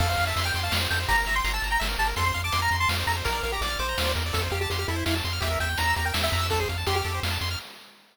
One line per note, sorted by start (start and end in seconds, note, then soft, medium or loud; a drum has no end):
0.00 0.16 F2 medium
0.00 0.08 A4 loud
0.00 0.09 F5 medium
0.00 kick loud
0.00 crash loud
0.08 0.16 C5 medium
0.08 0.24 F5 medium
0.17 0.33 F2 medium
0.17 0.26 F5 medium
0.17 closed hi-hat medium
0.27 0.44 E5 medium
0.27 0.35 A5 medium
0.36 0.51 F2 medium
0.36 0.45 C6 medium
0.36 closed hi-hat loud
0.44 0.60 G5 medium
0.44 0.52 F6 medium
0.54 0.70 F2 medium
0.54 0.64 C6 medium
0.54 closed hi-hat medium
0.63 0.72 F5 medium
0.63 0.72 A5 medium
0.71 0.87 F2 medium
0.71 0.79 F5 medium
0.71 snare loud
0.81 0.89 C5 medium
0.90 1.06 F2 medium
0.90 0.99 A4 medium
0.90 0.99 G5 medium
0.90 closed hi-hat medium
1.00 1.08 C5 medium
1.08 1.24 G1 medium
1.08 1.16 G4 loud
1.08 1.17 A#5 medium
1.08 kick loud
1.08 closed hi-hat loud
1.17 1.26 A#4 medium
1.17 1.35 A#5 medium
1.26 1.41 G1 medium
1.26 1.35 E5 medium
1.26 closed hi-hat medium
1.35 1.43 G5 medium
1.35 1.52 C6 medium
1.44 1.60 G1 medium
1.44 1.53 A#5 medium
1.44 closed hi-hat loud
1.54 1.69 A5 medium
1.54 1.62 E6 medium
1.62 1.78 G1 medium
1.62 1.72 A#5 medium
1.62 closed hi-hat medium
1.70 1.79 G5 medium
1.70 1.80 A#5 medium
1.80 1.97 G1 medium
1.80 1.88 E5 loud
1.80 snare loud
1.89 1.97 A#4 medium
1.98 2.14 G1 medium
1.98 2.08 G4 medium
1.98 2.07 A5 medium
1.98 closed hi-hat medium
2.07 2.15 A#4 medium
2.16 2.32 F2 medium
2.16 2.25 A4 medium
2.16 2.25 C6 medium
2.16 kick loud
2.16 closed hi-hat loud
2.25 2.33 C5 medium
2.25 2.41 C6 medium
2.34 2.51 F2 medium
2.34 2.42 F5 medium
2.34 closed hi-hat medium
2.44 2.53 A5 medium
2.44 2.61 D6 medium
2.52 2.69 F2 medium
2.52 2.61 C6 medium
2.52 closed hi-hat loud
2.62 2.77 A#5 medium
2.62 2.70 F6 medium
2.71 2.86 F2 medium
2.71 2.80 C6 medium
2.71 closed hi-hat medium
2.80 2.89 A5 medium
2.80 2.89 C6 medium
2.89 3.04 F2 medium
2.89 2.97 F5 medium
2.89 snare loud
2.99 3.07 C5 medium
3.07 3.22 F2 medium
3.07 3.16 A4 medium
3.07 3.16 A#5 medium
3.07 closed hi-hat medium
3.17 3.25 C5 medium
3.24 3.41 A#1 medium
3.24 3.33 A#4 medium
3.24 3.43 A#4 medium
3.24 kick loud
3.24 closed hi-hat loud
3.33 3.41 D5 medium
3.43 3.59 A#1 medium
3.43 3.52 A#4 medium
3.43 3.51 F5 medium
3.43 closed hi-hat medium
3.52 3.61 G4 medium
3.52 3.62 A#5 medium
3.61 3.77 A#1 medium
3.61 3.79 D5 medium
3.61 3.70 D6 medium
3.61 closed hi-hat loud
3.70 3.78 F6 medium
3.79 3.95 A#1 medium
3.79 4.12 C5 medium
3.79 3.87 D6 medium
3.79 closed hi-hat medium
3.89 3.97 A#5 medium
3.98 4.14 D#2 medium
3.98 4.06 F5 medium
3.98 snare loud
4.05 4.14 D5 medium
4.15 4.32 E2 medium
4.15 4.24 A#4 medium
4.15 closed hi-hat medium
4.26 4.34 D5 medium
4.33 4.49 F2 medium
4.33 4.41 A4 medium
4.33 4.42 A4 medium
4.33 kick loud
4.33 closed hi-hat loud
4.43 4.51 C5 medium
4.51 4.67 F2 medium
4.51 4.60 G4 medium
4.51 4.59 F5 medium
4.51 closed hi-hat medium
4.61 4.69 G4 medium
4.61 4.70 A5 medium
4.70 4.85 F2 medium
4.70 4.78 G4 medium
4.70 4.79 C6 medium
4.70 closed hi-hat loud
4.79 4.88 G4 medium
4.79 4.87 F6 medium
4.88 5.04 F2 medium
4.88 5.05 E4 medium
4.88 4.97 A4 medium
4.88 closed hi-hat medium
4.96 5.04 C5 medium
5.06 5.22 F2 medium
5.06 5.15 E4 medium
5.06 5.14 F5 medium
5.06 snare loud
5.15 5.23 A5 medium
5.24 5.40 F2 medium
5.24 5.33 C6 medium
5.24 closed hi-hat medium
5.33 5.41 F6 medium
5.41 5.57 E2 medium
5.41 5.49 G4 loud
5.41 5.59 E5 medium
5.41 kick loud
5.41 closed hi-hat loud
5.51 5.59 A#4 medium
5.60 5.76 E2 medium
5.60 5.69 E5 medium
5.60 5.78 G5 medium
5.60 closed hi-hat medium
5.69 5.77 G5 medium
5.78 5.94 E2 medium
5.78 5.86 A#5 medium
5.78 5.95 A#5 medium
5.78 closed hi-hat loud
5.87 5.95 E6 medium
5.95 6.12 E2 medium
5.95 6.04 G4 medium
5.95 6.05 A#5 medium
5.95 closed hi-hat medium
6.05 6.13 A#4 medium
6.05 6.14 G5 medium
6.14 6.30 E2 medium
6.14 6.22 E5 medium
6.14 snare loud
6.22 6.47 E5 medium
6.22 6.30 G5 medium
6.32 6.66 F2 medium
6.32 6.41 A#5 medium
6.32 open hi-hat medium
6.41 6.49 E6 medium
6.50 6.59 A4 medium
6.50 6.60 A4 loud
6.50 kick loud
6.50 closed hi-hat loud
6.60 6.68 G#4 medium
6.60 6.69 C5 medium
6.69 6.84 F2 medium
6.69 6.77 F5 medium
6.69 closed hi-hat medium
6.78 6.86 A5 medium
6.87 7.02 F2 medium
6.87 6.95 G4 medium
6.87 6.95 C6 medium
6.87 closed hi-hat loud
6.95 7.20 G4 medium
6.95 7.03 F6 medium
7.05 7.20 F2 medium
7.05 7.13 A4 medium
7.05 closed hi-hat medium
7.15 7.23 C5 medium
7.23 7.38 F2 medium
7.23 7.31 F5 medium
7.23 snare loud
7.30 7.38 A5 medium
7.41 7.56 F2 medium
7.41 7.49 C6 medium
7.41 closed hi-hat medium
7.51 7.59 F6 medium